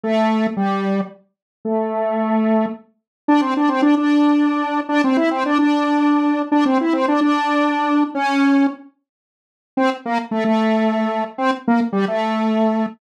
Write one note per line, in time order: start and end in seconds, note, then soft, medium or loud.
0.03 0.47 A3 medium
0.57 1.01 G3 medium
1.65 2.66 A3 medium
3.28 3.41 D4 loud
3.41 3.54 C4 medium
3.57 3.69 D4 medium
3.68 3.81 C4 medium
3.82 3.95 D4 medium
3.97 4.81 D4 medium
4.89 5.02 D4 loud
5.04 5.17 C4 medium
5.17 5.30 E4 medium
5.31 5.44 C4 medium
5.45 5.58 D4 medium
5.58 6.42 D4 medium
6.52 6.64 D4 loud
6.65 6.78 C4 medium
6.81 6.94 E4 medium
6.93 7.06 C4 medium
7.08 7.20 D4 medium
7.21 8.04 D4 medium
8.15 8.67 C#4 loud
9.77 9.90 C4 loud
10.05 10.18 A#3 loud
10.31 10.44 A3 medium
10.44 11.24 A3 medium
11.38 11.51 C4 loud
11.68 11.80 A#3 medium
11.92 12.05 G3 medium
12.08 12.86 A3 medium